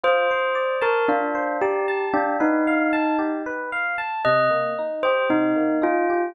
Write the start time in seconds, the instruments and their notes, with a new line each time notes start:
0.04 electric piano 1 F4, tubular bells C5
0.31 electric piano 1 C5
0.55 electric piano 1 D5
0.81 tubular bells A#4, electric piano 1 A5
1.08 tubular bells D4, electric piano 1 F4
1.35 electric piano 1 C5
1.62 tubular bells G4, electric piano 1 D5
1.88 electric piano 1 A5
2.13 tubular bells D4, electric piano 1 G4
2.40 tubular bells D#4, electric piano 1 B4
2.67 electric piano 1 F5
2.93 electric piano 1 A5
3.19 electric piano 1 G4
3.46 electric piano 1 B4
3.72 electric piano 1 F5
3.98 electric piano 1 A5
4.25 electric piano 1 C3, tubular bells D#5
4.51 electric piano 1 A#3
4.79 electric piano 1 D#4
5.03 electric piano 1 G4, tubular bells C5
5.29 electric piano 1 C3, tubular bells D#4
5.56 electric piano 1 A#3
5.82 electric piano 1 D#4, tubular bells F4
6.10 electric piano 1 G4